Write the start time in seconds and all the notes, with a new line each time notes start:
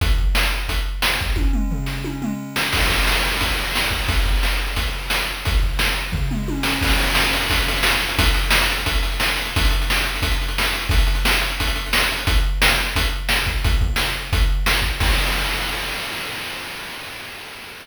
0.01 kick, closed hi-hat
0.18 kick
0.35 snare
0.69 kick, closed hi-hat
1.02 snare
1.21 kick
1.36 kick, high tom
1.53 mid tom
1.71 floor tom
1.86 snare
2.04 high tom
2.22 mid tom
2.56 snare
2.73 kick, crash
2.89 kick
3.07 snare
3.41 kick, closed hi-hat
3.75 snare
3.91 kick
4.08 kick, closed hi-hat
4.25 kick
4.43 snare
4.76 kick, closed hi-hat
5.10 snare
5.45 kick, closed hi-hat
5.63 kick
5.79 snare
6.12 kick, floor tom
6.31 mid tom
6.48 high tom
6.63 snare
6.81 kick, crash
6.90 closed hi-hat
7.00 closed hi-hat
7.07 closed hi-hat
7.15 snare
7.24 closed hi-hat
7.33 closed hi-hat
7.41 closed hi-hat
7.50 kick, closed hi-hat
7.58 closed hi-hat
7.68 closed hi-hat
7.76 closed hi-hat
7.83 snare
7.92 closed hi-hat
8.00 closed hi-hat
8.09 closed hi-hat
8.19 kick, closed hi-hat
8.26 closed hi-hat
8.34 closed hi-hat
8.44 closed hi-hat
8.51 snare
8.60 closed hi-hat
8.70 closed hi-hat
8.77 closed hi-hat
8.86 kick, closed hi-hat
8.95 closed hi-hat
9.03 closed hi-hat
9.12 closed hi-hat
9.20 snare
9.29 closed hi-hat
9.37 closed hi-hat
9.45 closed hi-hat
9.56 kick, closed hi-hat
9.65 closed hi-hat
9.71 closed hi-hat
9.82 closed hi-hat
9.90 snare
9.97 closed hi-hat
10.05 closed hi-hat
10.15 closed hi-hat
10.22 kick, closed hi-hat
10.32 closed hi-hat
10.41 closed hi-hat
10.48 closed hi-hat
10.58 snare
10.65 closed hi-hat
10.74 closed hi-hat
10.82 closed hi-hat
10.89 kick, closed hi-hat
10.98 closed hi-hat
11.07 closed hi-hat
11.15 closed hi-hat
11.25 snare
11.32 closed hi-hat
11.41 closed hi-hat
11.51 closed hi-hat
11.60 kick, closed hi-hat
11.67 closed hi-hat
11.76 closed hi-hat
11.86 closed hi-hat
11.93 snare
12.01 closed hi-hat
12.12 closed hi-hat
12.18 closed hi-hat
12.27 kick, closed hi-hat
12.62 snare
12.96 kick, closed hi-hat
13.29 snare
13.47 kick
13.64 kick, closed hi-hat
13.81 kick
13.96 snare
14.33 kick, closed hi-hat
14.66 snare
14.82 kick
15.00 kick, crash